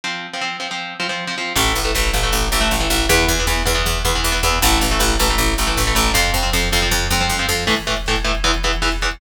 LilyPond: <<
  \new Staff \with { instrumentName = "Overdriven Guitar" } { \time 4/4 \key a \minor \tempo 4 = 157 <f c'>8. <f c'>16 <f c'>8 <f c'>16 <f c'>8. <f c'>16 <f c'>8 <f c'>16 <f c'>8 | <e a>8. <e a>16 <e a>8 <e a>16 <e a>8. <e a>16 <e a>8 <e a>16 <e a>8 | <e b>8. <e b>16 <e b>8 <e b>16 <e b>8. <e b>16 <e b>8 <e b>16 <e b>8 | <e a>8. <e a>16 <e a>8 <e a>16 <e a>8. <e a>16 <e a>8 <e a>16 <e a>8 |
<f c'>8. <f c'>16 <f c'>8 <f c'>16 <f c'>8. <f c'>16 <f c'>8 <f c'>16 <f c'>8 | <a, e a>8 <a, e a>8 <a, e a>8 <a, e a>8 <e, e b>8 <e, e b>8 <e, e b>8 <e, e b>8 | }
  \new Staff \with { instrumentName = "Electric Bass (finger)" } { \clef bass \time 4/4 \key a \minor r1 | a,,8 a,,8 a,,8 a,,8 a,,8 a,,8 a,,8 a,,8 | e,8 e,8 e,8 e,8 e,8 e,8 e,8 e,8 | a,,8 a,,8 a,,8 a,,8 a,,8 a,,8 a,,8 a,,8 |
f,8 f,8 f,8 f,8 f,8 f,8 f,8 f,8 | r1 | }
  \new DrumStaff \with { instrumentName = "Drums" } \drummode { \time 4/4 r4 r4 r4 r4 | <cymc bd>16 bd16 <hh bd>16 bd16 <bd sn>16 bd16 <hh bd>16 bd16 <hh bd>16 bd16 <hh bd>16 bd16 <bd sn>16 bd16 <hh bd>16 bd16 | <hh bd>16 bd16 <hh bd>16 bd16 <bd sn>16 bd16 <hh bd>16 bd16 <hh bd>16 bd16 <hh bd>16 bd16 <bd sn>16 bd16 <hh bd>16 bd16 | <hh bd>16 bd16 <hh bd>16 bd16 <bd sn>16 bd16 <hh bd>16 bd16 <hh bd>16 bd16 <hh bd>16 bd16 <bd sn>16 bd16 <hh bd>16 bd16 |
<hh bd>16 bd16 <hh bd>16 bd16 <bd sn>16 bd16 <hh bd>16 bd16 <bd tomfh>8 toml8 tommh8 sn8 | <cymc bd>16 <hh bd>16 <hh bd>16 <hh bd>16 <bd sn>16 <hh bd>16 <hh bd>16 <hh bd>16 <hh bd>16 <hh bd>16 <hh bd>16 <hh bd>16 <bd sn>16 <hh bd>16 <hh bd>16 <hh bd>16 | }
>>